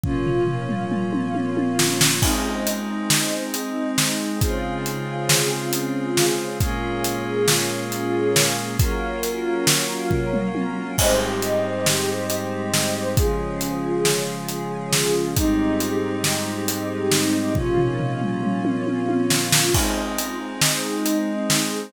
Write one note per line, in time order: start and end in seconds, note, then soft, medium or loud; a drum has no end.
0.03 2.21 A#2 medium
0.03 2.21 F3 medium
0.03 2.20 A#3 medium
0.03 2.20 C#4 medium
0.03 2.21 C#4 medium
0.03 2.20 F4 medium
0.03 kick medium
0.03 floor tom medium
0.26 floor tom medium
0.47 floor tom medium
0.69 mid tom medium
0.92 mid tom medium
1.13 high tom medium
1.35 high tom medium
1.57 high tom medium
1.79 snare medium
2.01 snare loud
2.22 4.39 G#3 medium
2.22 4.39 C4 medium
2.22 4.39 D#4 medium
2.22 kick medium
2.22 crash medium
2.67 closed hi-hat medium
3.10 snare medium
3.54 closed hi-hat medium
3.98 snare medium
4.41 6.58 C#3 medium
4.41 6.58 G#3 medium
4.41 6.58 C4 medium
4.41 6.58 F4 medium
4.41 6.58 G#4 medium
4.41 kick medium
4.41 closed hi-hat medium
4.86 closed hi-hat medium
5.29 snare loud
5.73 closed hi-hat medium
6.17 snare medium
6.60 8.76 A#2 medium
6.60 8.76 G#3 medium
6.60 8.77 A#3 medium
6.60 8.76 C#4 medium
6.60 8.77 C#4 medium
6.60 8.76 F4 medium
6.60 8.77 F4 medium
6.60 8.77 G#4 medium
6.60 kick medium
6.60 closed hi-hat medium
7.04 closed hi-hat medium
7.48 snare medium
7.92 closed hi-hat medium
8.36 snare medium
8.79 10.96 F#3 medium
8.79 10.96 A#3 medium
8.79 10.96 C#4 medium
8.79 10.96 F4 medium
8.79 10.96 A#4 medium
8.79 kick medium
8.79 closed hi-hat medium
9.23 closed hi-hat medium
9.67 snare medium
10.11 kick medium
10.11 floor tom medium
10.33 mid tom medium
10.55 high tom medium
10.98 13.16 G#2 medium
10.98 13.16 G3 medium
10.98 13.15 G#3 medium
10.98 13.16 C4 medium
10.98 13.16 D#4 medium
10.98 13.15 G4 medium
10.98 13.15 C5 medium
10.98 13.15 D#5 medium
10.98 kick medium
10.98 crash loud
11.42 closed hi-hat medium
11.86 snare medium
12.30 closed hi-hat medium
12.74 snare medium
13.16 15.33 C#3 medium
13.16 15.33 F3 medium
13.16 15.33 G#3 medium
13.16 15.34 C#4 medium
13.16 15.34 F4 medium
13.16 15.34 G#4 medium
13.16 kick loud
13.16 closed hi-hat medium
13.61 closed hi-hat medium
14.05 snare medium
14.49 closed hi-hat medium
14.93 snare medium
15.36 17.54 G#2 medium
15.36 17.54 G3 medium
15.36 17.53 G#3 medium
15.36 17.53 C4 medium
15.36 17.54 C4 medium
15.36 17.53 D#4 medium
15.36 17.54 D#4 medium
15.36 17.53 G4 medium
15.36 kick medium
15.36 closed hi-hat medium
15.80 closed hi-hat medium
16.24 snare medium
16.68 closed hi-hat medium
17.11 snare medium
17.55 19.72 A#2 medium
17.55 19.72 F3 medium
17.55 19.72 A#3 medium
17.55 19.72 C#4 medium
17.55 19.72 F4 medium
17.55 kick medium
17.55 floor tom medium
17.77 floor tom medium
17.99 floor tom medium
18.21 mid tom medium
18.43 mid tom medium
18.65 high tom medium
18.87 high tom medium
19.09 high tom medium
19.30 snare medium
19.52 snare loud
19.74 21.91 G#3 medium
19.74 21.91 C4 medium
19.74 21.91 D#4 medium
19.74 kick medium
19.74 crash medium
20.18 closed hi-hat medium
20.61 snare medium
21.06 closed hi-hat medium
21.50 snare medium